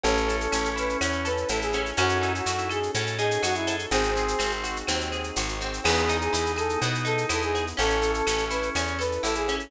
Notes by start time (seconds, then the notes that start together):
0.03 A1 C#4 E4 A4, cowbell, shaker
0.17 shaker
0.28 A4, shaker
0.40 A4, shaker
0.52 A1 C#4, claves, shaker
0.65 shaker
0.76 E4 B4, shaker
0.89 shaker
1.01 E2 C#4, cowbell, claves, shaker
1.12 shaker
1.25 A4 B4, shaker
1.37 shaker
1.48 A1 E4 A4, cowbell, shaker
1.62 G#4, shaker
1.73 C#4, cowbell, shaker
1.86 shaker
1.97 F#2 C#4 D#4 F#4 A4, cowbell, claves, shaker
2.09 shaker
2.21 D#4 E4, shaker
2.35 F#4, shaker
2.46 F#2 F#4, shaker
2.58 E4, shaker
2.69 G#4 A4, claves, shaker
2.83 shaker
2.94 A2 C#4 A4, cowbell, shaker
3.07 shaker
3.18 D#4 G#4, shaker
3.31 shaker
3.43 F#2 F#4, cowbell, claves, shaker
3.54 E4, shaker
3.67 A4, cowbell, shaker
3.79 shaker
3.90 G#1 C4 D#4 F#4 G#4, cowbell, shaker
4.03 shaker
4.16 C4 G#4, shaker
4.28 shaker
4.39 G#1 C4, claves, shaker
4.51 shaker
4.64 F#4, shaker
4.76 shaker
4.87 D#2 C4, cowbell, claves, shaker
5.01 shaker
5.12 G#4, shaker
5.23 shaker
5.36 G#1 F#4, cowbell, shaker
5.48 shaker
5.60 C4, cowbell, shaker
5.73 shaker
5.84 E2 B3 D#4 E4 G#4, crash, cowbell, claves
5.96 shaker
6.09 D#4, shaker
6.21 G#4, shaker
6.33 E2 E4, shaker
6.46 shaker
6.56 G#4 A4, claves, shaker
6.69 shaker
6.81 B2 B3, cowbell, shaker
6.95 shaker
7.05 D#4 A4, shaker
7.18 shaker
7.29 E2 E4 A4, cowbell, claves, shaker
7.42 G#4, shaker
7.54 G#4, cowbell, shaker
7.67 shaker
7.77 A1 C#4 E4 A4, cowbell, shaker
7.90 shaker
8.02 A4, shaker
8.14 A4, shaker
8.27 A1 C#4, claves, shaker
8.38 shaker
8.50 E4 B4, shaker
8.62 shaker
8.75 E2 C#4, cowbell, claves, shaker
8.87 shaker
8.99 A4 B4, shaker
9.12 shaker
9.23 A1 E4 A4, cowbell, shaker
9.35 G#4, shaker
9.48 C#4, cowbell, shaker
9.60 shaker